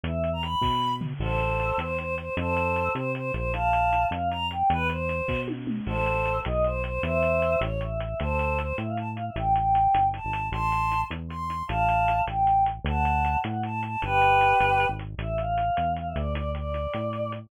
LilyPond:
<<
  \new Staff \with { instrumentName = "Choir Aahs" } { \time 6/8 \key a \minor \tempo 4. = 103 e''8. ais''16 b''4. r8 | <a' c''>4. c''8 c''8 c''8 | <a' c''>4. c''8 c''8 c''8 | <f'' a''>4. f''8 bes''8 g''8 |
b'8 c''4. r4 | <a' c''>4. dis''8 c''8 c''8 | <c'' e''>4. cis''8 e''8 e''8 | <a' c''>4 c''8 e''16 f''16 a''16 r16 f''16 e''16 |
g''8 g''4. a''4 | <a'' c'''>4. r8 c'''4 | <f'' a''>4. g''4 r8 | <fis'' a''>4. fis''8 a''8 a''8 |
<g' b'>2~ <g' b'>8 r8 | e''8 f''4. f''16 e''16 d''8 | d''8 d''2 r8 | }
  \new Staff \with { instrumentName = "Synth Bass 1" } { \clef bass \time 6/8 \key a \minor e,4. b,4. | a,,4. e,4. | f,4. c4 bes,,8~ | bes,,4. f,4. |
e,4. b,4. | a,,4. b,,4. | e,4. a,,4. | d,4. a,4. |
a,,4. g,,8. gis,,8. | a,,4. e,4. | a,,4. a,,4. | d,4. a,4. |
g,,4. g,,8. gis,,8. | a,,4. e,4 d,8~ | d,4. a,4. | }
  \new DrumStaff \with { instrumentName = "Drums" } \drummode { \time 6/8 hh8 hh8 hh8 <bd sn>4 tomfh8 | cymc8 hh8 hh8 hh8 hh8 hh8 | hh8 hh8 hh8 hh8 hh8 hh8 | hh8 hh8 hh8 hh8 hh8 hh8 |
hh8 hh8 hh8 <bd sn>8 tommh8 toml8 | cymc8 hh8 hh8 hh8 hh8 hh8 | hh8 hh8 hh8 hh8 hh8 hh8 | hh8 hh8 hh8 hh8 hh8 hh8 |
hh8 hh8 hh8 hh8 hh8 hh8 | hh8 hh8 hh8 hh8 hh8 hh8 | hh8 hh8 hh8 hh8 hh8 hh8 | hh8 hh8 hh8 hh8 hh8 hh8 |
hh8 hh8 hh8 hh8 hh8 hh8 | hh8 hh8 hh8 hh8 hh8 hh8 | hh8 hh8 hh8 hh8 hh8 hh8 | }
>>